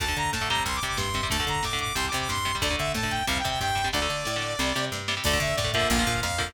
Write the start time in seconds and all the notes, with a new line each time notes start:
0.00 D2 D3 A3 A5, kick, closed hi-hat
0.08 D3 A3, kick
0.16 D3 A#5, kick, closed hi-hat
0.25 kick
0.33 A2 A5, kick, snare
0.41 D3 A3, kick
0.49 C3 G3 A#5, kick, closed hi-hat
0.57 kick
0.66 C2 C6, kick, closed hi-hat
0.74 D6, kick
0.82 C3 G3, kick, closed hi-hat
0.87 D6, kick
0.97 G2 C6, kick, snare
1.08 kick
1.14 C3 G3, kick, closed hi-hat
1.23 C3 G3, kick
1.30 D2 D3 A3 A5, kick, closed hi-hat
1.40 D3 A3, kick
1.47 D3 A#5, kick, closed hi-hat
1.56 kick
1.63 A2 D6, kick, snare
1.73 D3 A3, kick
1.79 D6, kick, closed hi-hat
1.87 kick
1.95 C2 C3 G3 C6, kick, closed hi-hat
2.04 D6, kick
2.12 C3 G3, kick, closed hi-hat
2.20 D6, kick
2.29 G2 C6, kick, snare
2.37 kick
2.45 C3 G3, kick, closed hi-hat
2.55 C3 G3, kick
2.62 D2 D3 A3 D5, kick, closed hi-hat
2.70 D3 A3, kick
2.78 D3 E5, kick, closed hi-hat
2.87 kick
2.94 A2 A5, kick, snare
3.03 D3 A3, kick
3.10 G5, kick, closed hi-hat
3.20 kick
3.27 C2 C3 G3 F5, kick, closed hi-hat
3.37 G5, kick
3.44 C3 G3, kick, closed hi-hat
3.49 G5, kick
3.60 G2 G5, kick, snare
3.69 kick
3.75 C3 G3, kick, closed hi-hat
3.84 C3 G3, kick
3.93 D2 D3 A3 D5, kick, snare
4.02 D3 A3
4.09 D3, snare
4.25 A2, snare
4.36 D3 A3
4.42 snare
4.59 C2 C3 G3, snare
4.75 C3 G3, snare
4.92 G2, snare
5.08 C3 G3, snare
5.17 C3 G3
5.24 D2 D3 A3 D5, kick, crash
5.33 D3 A3, kick
5.40 D3 E5, kick, closed hi-hat
5.49 kick
5.56 A2 D5, kick, snare
5.64 D3 A3, kick
5.73 D3 F3 A#3 E5, kick, closed hi-hat
5.81 kick
5.90 A#1 F5, kick, closed hi-hat
5.97 D3 F3 A#3, kick
6.07 A#2, kick, closed hi-hat
6.15 kick
6.22 F2 F5, kick, snare
6.31 kick
6.38 D3 F3 A#3, kick, open hi-hat
6.47 kick